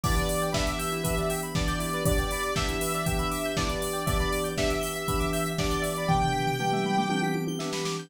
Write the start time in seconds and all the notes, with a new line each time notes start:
0.03 E3 B3 D4 E4 G4 D5, kick, crash
0.16 B4, closed hi-hat
0.29 D5, open hi-hat
0.42 G5, closed hi-hat
0.52 E3 B3 D4 G4 E5 B5, kick, snare
0.67 D6, closed hi-hat
0.79 G6, open hi-hat
0.92 E4, closed hi-hat
1.03 E3 B3 D4 G4 B4, kick, closed hi-hat
1.17 D5, closed hi-hat
1.30 G5, open hi-hat
1.42 B5, closed hi-hat
1.55 E3 B3 D4 G4 D5 D6, kick, snare
1.68 G6, closed hi-hat
1.79 E4, open hi-hat
1.93 B4, closed hi-hat
2.05 E3 B3 D4 G4 D5, kick, closed hi-hat
2.18 G5, closed hi-hat
2.31 B5, open hi-hat
2.43 D6, closed hi-hat
2.55 E3 B3 D4 G4 E5 G6, kick, snare
2.68 E4, closed hi-hat
2.81 B4, open hi-hat
2.94 D5, closed hi-hat
3.06 E3 B3 D4 G4 G5, kick, closed hi-hat
3.19 B5, closed hi-hat
3.31 D6, open hi-hat
3.44 G6, closed hi-hat
3.57 E3 B3 D4 E4 G4 D5, kick, snare
3.69 B4, closed hi-hat
3.82 D5, open hi-hat
3.93 G5, closed hi-hat
4.06 E3 B3 D4 G4 D5 E5, kick, closed hi-hat
4.20 B5, closed hi-hat
4.32 D6, open hi-hat
4.44 G6, closed hi-hat
4.57 E3 B3 D4 G4 E5 B6, kick, snare
4.70 D7, closed hi-hat
4.81 G7, open hi-hat
4.95 E5, closed hi-hat
5.08 E3 B3 D4 G4 B5, kick, closed hi-hat
5.20 D6, closed hi-hat
5.33 G6, open hi-hat
5.46 B6, closed hi-hat
5.58 E3 B3 D4 G4 D5 D7, kick, snare
5.71 G7, closed hi-hat
5.82 E5, open hi-hat
5.96 B5, closed hi-hat
6.08 E3 B3 D4 G4 G5 D6, kick, floor tom
6.21 G6, floor tom
6.32 B6, floor tom
6.47 D7, floor tom
6.59 E3 B3 D4 G4 G7, mid tom
6.72 E5, mid tom
6.84 B5, mid tom
6.97 D6, mid tom
7.10 E3 B3 D4 G4 G6, high tom
7.22 B6, high tom
7.34 D7, high tom
7.47 G7, high tom
7.59 E3 B3 D4 G4 E5, snare
7.73 B5, snare
7.85 D6, snare
7.99 G6